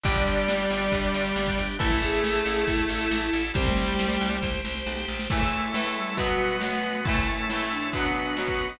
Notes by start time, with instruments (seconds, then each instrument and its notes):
0.03 electric bass (finger) G1, acoustic guitar (steel) D3 G3, distortion guitar G3 G4, drawbar organ D4 G4, string ensemble 1 D4 G4, flute D5, kick, closed hi-hat
0.16 kick, closed hi-hat
0.26 electric bass (finger) G1, closed hi-hat
0.38 closed hi-hat
0.48 electric bass (finger) G1, snare
0.59 closed hi-hat
0.70 electric bass (finger) G1, closed hi-hat
0.82 closed hi-hat
0.92 electric bass (finger) G1, kick, closed hi-hat
1.03 closed hi-hat
1.14 electric bass (finger) G1, closed hi-hat
1.25 closed hi-hat
1.36 electric bass (finger) G1, snare
1.47 kick, closed hi-hat
1.58 electric bass (finger) G1, closed hi-hat
1.69 closed hi-hat
1.79 electric bass (finger) A1, acoustic guitar (steel) E3 A3, distortion guitar A3 A4, string ensemble 1 E4 A4, flute E4, drawbar organ E4 A4, kick, closed hi-hat
1.91 kick, closed hi-hat
2.02 electric bass (finger) A1, flute G#4, closed hi-hat
2.12 closed hi-hat
2.24 electric bass (finger) A1, snare
2.35 closed hi-hat
2.45 electric bass (finger) A1, flute G#4, closed hi-hat
2.57 closed hi-hat
2.67 electric bass (finger) A1, flute E4, kick, closed hi-hat
2.78 closed hi-hat
2.89 electric bass (finger) A1, closed hi-hat
3.00 closed hi-hat
3.11 electric bass (finger) A1, snare
3.22 closed hi-hat
3.33 electric bass (finger) A1, closed hi-hat
3.44 open hi-hat
3.54 electric bass (finger) C2, acoustic guitar (steel) G3 C4, distortion guitar G3 G4, flute C4, string ensemble 1 G4 C5, drawbar organ G4 C5, kick, closed hi-hat
3.66 flute A3, kick, closed hi-hat
3.76 electric bass (finger) C2, closed hi-hat
3.88 closed hi-hat
3.99 electric bass (finger) C2, snare
4.10 closed hi-hat
4.21 electric bass (finger) C2, closed hi-hat
4.32 closed hi-hat
4.42 electric bass (finger) C2, kick, snare
4.54 snare
4.65 electric bass (finger) C2, snare
4.75 snare
4.86 electric bass (finger) B1, snare
4.98 snare
5.08 electric bass (finger) A#1, snare
5.19 snare
5.30 acoustic guitar (steel) A2 E3 A3, flute A3, drawbar organ A3 E4 A4, string ensemble 1 A3 E4 A4, kick, crash
5.41 kick, ride
5.52 ride
5.63 ride
5.74 acoustic guitar (steel) A2 E3 A3, snare
5.85 ride
5.96 flute G3, ride
6.07 ride
6.17 acoustic guitar (steel) B2 F#3 B3, string ensemble 1 B2 B3 F#4, drawbar organ B3 F#4 B4, kick, ride
6.29 ride
6.40 ride
6.51 ride
6.60 acoustic guitar (steel) B2 F#3 B3, flute A3, snare
6.73 ride
6.83 ride
6.95 ride
7.05 acoustic guitar (steel) A2 E3, string ensemble 1 A2 A3 E4, drawbar organ A3 E4 A4, flute A3, kick, ride
7.09 acoustic guitar (steel) A3
7.16 kick, ride
7.27 ride
7.38 ride
7.50 acoustic guitar (steel) A2 E3 A3, snare
7.60 ride
7.71 flute D4, ride
7.82 ride
7.93 string ensemble 1 B2 B3 F#4, acoustic guitar (steel) B2 F#3, drawbar organ B3 F#4 B4, kick, ride
7.98 acoustic guitar (steel) B3
8.04 ride
8.15 ride
8.26 ride
8.37 acoustic guitar (steel) B2 F#3 B3, snare
8.47 kick, ride
8.59 ride
8.70 ride